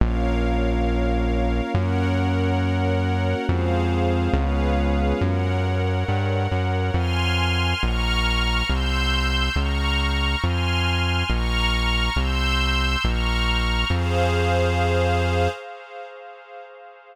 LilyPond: <<
  \new Staff \with { instrumentName = "Pad 5 (bowed)" } { \time 6/8 \key bes \minor \tempo 4. = 69 <bes des' f'>2. | <bes des' ges'>2. | <aes c' f'>4. <aes ces' des' f'>4. | r2. |
\key f \minor r2. | r2. | r2. | r2. |
r2. | }
  \new Staff \with { instrumentName = "String Ensemble 1" } { \time 6/8 \key bes \minor <bes' des'' f''>2. | <bes' des'' ges''>2. | <aes' c'' f''>4. <aes' ces'' des'' f''>4. | <bes' des'' ges''>2. |
\key f \minor <aes'' c''' f'''>4. <bes'' des''' f'''>4. | <c''' e''' g'''>4. <bes'' des''' f'''>4. | <aes'' c''' f'''>4. <bes'' des''' f'''>4. | <c''' e''' g'''>4. <bes'' des''' f'''>4. |
<aes' c'' f''>2. | }
  \new Staff \with { instrumentName = "Synth Bass 1" } { \clef bass \time 6/8 \key bes \minor bes,,2. | ges,2. | f,4. des,4. | ges,4. g,8. ges,8. |
\key f \minor f,4. bes,,4. | c,4. des,4. | f,4. bes,,4. | c,4. bes,,4. |
f,2. | }
>>